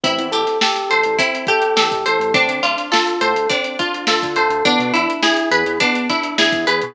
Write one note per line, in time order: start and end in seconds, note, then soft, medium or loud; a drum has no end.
0.03 0.19 A1 loud
0.03 0.29 C4 medium
0.03 1.18 E4 medium
0.03 kick loud
0.03 closed hi-hat loud
0.19 0.32 E2 medium
0.19 closed hi-hat medium
0.32 0.46 A1 medium
0.32 1.48 G4 medium
0.32 0.58 A4 medium
0.32 closed hi-hat medium
0.47 snare soft
0.47 closed hi-hat medium
0.61 0.88 G4 medium
0.61 1.76 A4 medium
0.61 snare loud
0.76 snare soft
0.76 closed hi-hat medium
0.90 1.04 A1 medium
0.90 1.16 A4 medium
0.90 2.05 C5 medium
0.90 closed hi-hat medium
1.03 1.18 A1 medium
1.03 closed hi-hat medium
1.19 1.46 C4 medium
1.19 2.28 E4 medium
1.19 kick loud
1.19 closed hi-hat loud
1.35 closed hi-hat medium
1.47 2.30 G4 medium
1.47 1.74 A4 medium
1.47 kick loud
1.47 closed hi-hat medium
1.62 closed hi-hat medium
1.76 1.89 E2 medium
1.76 2.02 G4 medium
1.76 2.31 A4 medium
1.76 snare loud
1.91 2.04 A1 medium
1.91 kick medium
1.91 closed hi-hat medium
2.06 2.19 A1 medium
2.06 2.32 A4 medium
2.06 2.33 C5 medium
2.06 closed hi-hat medium
2.20 2.33 A1 medium
2.20 closed hi-hat medium
2.34 2.48 D2 loud
2.34 2.61 C4 medium
2.34 3.49 D4 medium
2.34 kick loud
2.34 closed hi-hat loud
2.48 2.61 D2 medium
2.48 closed hi-hat medium
2.63 2.76 D2 medium
2.63 2.89 D4 medium
2.63 3.79 F4 medium
2.63 closed hi-hat medium
2.78 snare soft
2.78 closed hi-hat medium
2.92 3.18 F4 medium
2.92 4.07 A4 medium
2.92 snare loud
3.07 closed hi-hat medium
3.21 3.34 A2 medium
3.21 3.47 A4 medium
3.21 4.36 C5 medium
3.21 snare soft
3.21 closed hi-hat medium
3.34 3.47 D2 medium
3.34 closed hi-hat medium
3.50 3.77 C4 medium
3.50 4.59 D4 medium
3.50 kick loud
3.50 closed hi-hat loud
3.64 closed hi-hat medium
3.79 4.05 D4 medium
3.79 4.61 F4 medium
3.79 kick medium
3.79 closed hi-hat medium
3.94 closed hi-hat medium
4.07 4.21 D2 medium
4.07 4.34 F4 medium
4.07 4.62 A4 medium
4.07 snare loud
4.22 4.36 D3 medium
4.22 kick medium
4.22 snare medium
4.22 closed hi-hat medium
4.36 4.49 D2 medium
4.36 4.63 A4 medium
4.36 4.64 C5 medium
4.36 closed hi-hat medium
4.50 4.63 D2 loud
4.50 closed hi-hat medium
4.65 4.78 E2 loud
4.65 4.92 B3 medium
4.65 5.80 D4 medium
4.65 kick loud
4.65 closed hi-hat loud
4.79 4.92 B2 loud
4.79 closed hi-hat medium
4.94 5.07 E2 loud
4.94 5.20 D4 medium
4.94 6.09 E4 medium
4.94 closed hi-hat medium
5.10 closed hi-hat medium
5.23 5.49 E4 medium
5.23 6.38 G#4 medium
5.23 snare loud
5.37 closed hi-hat medium
5.51 5.64 E2 loud
5.51 5.78 G#4 medium
5.51 6.67 B4 medium
5.51 closed hi-hat loud
5.66 5.79 E2 loud
5.66 closed hi-hat medium
5.80 6.07 B3 medium
5.80 6.90 D4 medium
5.80 kick loud
5.80 closed hi-hat loud
5.95 closed hi-hat medium
6.09 6.36 D4 medium
6.09 6.92 E4 medium
6.09 kick medium
6.09 snare soft
6.09 closed hi-hat medium
6.23 closed hi-hat medium
6.38 6.51 E2 medium
6.38 6.64 E4 medium
6.38 6.94 G#4 medium
6.38 snare loud
6.52 6.66 E2 medium
6.52 kick loud
6.52 closed hi-hat medium
6.67 6.81 E2 loud
6.67 6.93 G#4 medium
6.67 6.94 B4 medium
6.67 closed hi-hat medium
6.82 6.95 B2 loud
6.82 closed hi-hat medium